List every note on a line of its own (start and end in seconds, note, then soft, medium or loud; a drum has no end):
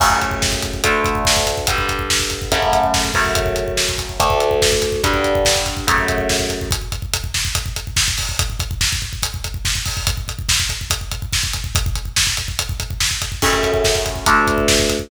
0.00 0.82 F#2 medium
0.00 0.82 C#3 medium
0.00 0.82 A3 medium
0.00 kick loud
0.00 crash loud
0.10 kick medium
0.22 kick medium
0.22 closed hi-hat medium
0.31 kick medium
0.42 kick medium
0.42 snare loud
0.52 kick medium
0.62 kick medium
0.62 closed hi-hat medium
0.74 kick medium
0.84 1.66 D2 medium
0.84 1.66 D3 medium
0.84 1.66 A3 loud
0.84 kick medium
0.84 closed hi-hat loud
1.04 kick medium
1.04 closed hi-hat medium
1.15 kick medium
1.25 kick medium
1.25 snare loud
1.37 kick medium
1.47 kick medium
1.47 closed hi-hat medium
1.58 kick medium
1.67 2.50 G2 medium
1.67 2.50 D3 medium
1.67 2.50 G3 medium
1.67 kick loud
1.67 closed hi-hat loud
1.78 kick medium
1.89 kick medium
1.89 closed hi-hat medium
1.99 kick medium
2.10 kick medium
2.10 snare loud
2.20 kick medium
2.30 kick medium
2.30 closed hi-hat medium
2.42 kick medium
2.52 3.12 F#2 medium
2.52 3.12 C#3 medium
2.52 3.12 A3 medium
2.52 kick medium
2.52 closed hi-hat medium
2.62 kick medium
2.73 kick medium
2.73 closed hi-hat medium
2.83 kick medium
2.94 kick medium
2.94 snare loud
3.05 kick medium
3.14 4.18 F#2 medium
3.14 4.18 C#3 medium
3.14 4.18 A3 medium
3.14 kick medium
3.14 open hi-hat medium
3.25 kick medium
3.35 kick loud
3.35 closed hi-hat loud
3.46 kick medium
3.56 kick medium
3.56 closed hi-hat medium
3.68 kick medium
3.77 kick medium
3.77 snare loud
3.89 kick medium
3.98 kick medium
3.98 closed hi-hat medium
4.09 kick medium
4.20 5.02 D2 loud
4.20 5.02 D3 medium
4.20 5.02 A3 medium
4.20 kick medium
4.20 closed hi-hat loud
4.30 kick medium
4.40 closed hi-hat medium
4.51 kick medium
4.62 kick medium
4.62 snare loud
4.72 kick medium
4.82 kick medium
4.82 closed hi-hat medium
4.92 kick medium
5.03 5.86 G2 medium
5.03 5.86 D3 medium
5.03 5.86 G3 medium
5.03 kick loud
5.03 closed hi-hat medium
5.14 kick medium
5.24 kick medium
5.24 closed hi-hat medium
5.35 kick medium
5.45 kick medium
5.45 snare loud
5.56 kick medium
5.66 kick medium
5.66 closed hi-hat medium
5.77 kick medium
5.87 6.70 F#2 medium
5.87 6.70 C#3 medium
5.87 6.70 A3 medium
5.87 kick loud
5.87 closed hi-hat loud
5.98 kick medium
6.08 kick medium
6.08 closed hi-hat medium
6.18 kick medium
6.29 kick medium
6.29 snare loud
6.39 kick medium
6.50 kick medium
6.50 closed hi-hat medium
6.61 kick medium
6.71 kick loud
6.71 closed hi-hat loud
6.81 kick medium
6.92 kick medium
6.92 closed hi-hat medium
7.02 kick medium
7.14 kick medium
7.14 closed hi-hat loud
7.24 kick medium
7.34 kick medium
7.34 snare loud
7.45 kick medium
7.55 kick loud
7.55 closed hi-hat loud
7.66 kick medium
7.76 kick medium
7.76 closed hi-hat medium
7.87 kick medium
7.96 kick medium
7.96 snare loud
8.08 kick medium
8.18 kick medium
8.18 open hi-hat medium
8.29 kick medium
8.39 kick loud
8.39 closed hi-hat loud
8.50 kick medium
8.60 kick loud
8.60 closed hi-hat medium
8.71 kick medium
8.81 kick medium
8.81 snare loud
8.92 kick loud
9.02 kick medium
9.13 kick medium
9.23 kick medium
9.23 closed hi-hat loud
9.34 kick medium
9.44 kick medium
9.44 closed hi-hat medium
9.54 kick medium
9.65 kick medium
9.65 snare loud
9.75 kick medium
9.85 kick medium
9.85 open hi-hat medium
9.97 kick medium
10.07 kick loud
10.07 closed hi-hat loud
10.17 kick medium
10.28 kick medium
10.28 closed hi-hat medium
10.39 kick medium
10.49 kick medium
10.49 snare loud
10.60 kick medium
10.69 kick medium
10.69 closed hi-hat medium
10.81 kick medium
10.90 kick loud
10.90 closed hi-hat loud
11.01 kick medium
11.11 kick medium
11.11 closed hi-hat medium
11.22 kick medium
11.33 kick medium
11.33 snare loud
11.43 kick medium
11.53 kick medium
11.53 closed hi-hat medium
11.64 kick medium
11.75 kick loud
11.75 closed hi-hat loud
11.86 kick loud
11.95 kick medium
11.95 closed hi-hat medium
12.05 kick medium
12.16 kick medium
12.16 snare loud
12.27 kick medium
12.37 kick medium
12.37 closed hi-hat medium
12.48 kick medium
12.59 kick medium
12.59 closed hi-hat loud
12.69 kick loud
12.80 kick medium
12.80 closed hi-hat medium
12.90 kick medium
13.00 kick medium
13.00 snare loud
13.11 kick medium
13.22 kick medium
13.22 closed hi-hat medium
13.32 kick medium
13.42 14.25 F#2 medium
13.42 14.25 C#3 medium
13.42 14.25 A3 medium
13.42 kick loud
13.42 crash loud
13.53 kick medium
13.63 kick medium
13.63 closed hi-hat medium
13.74 kick medium
13.84 kick medium
13.84 snare loud
13.95 kick medium
14.06 kick medium
14.06 closed hi-hat medium
14.16 kick medium
14.26 15.09 D2 medium
14.26 15.09 D3 medium
14.26 15.09 A3 loud
14.26 kick medium
14.26 closed hi-hat loud
14.47 kick medium
14.47 closed hi-hat medium
14.58 kick medium
14.68 kick medium
14.68 snare loud
14.79 kick medium
14.89 kick medium
14.89 closed hi-hat medium
14.99 kick medium